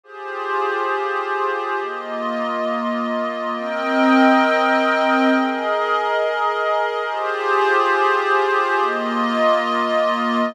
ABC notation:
X:1
M:4/4
L:1/8
Q:1/4=137
K:Cm
V:1 name="Pad 5 (bowed)"
[FGAc]8 | [B,Fe]8 | [CBeg]8 | [ABe]8 |
[FGAc]8 | [B,Fe]8 |]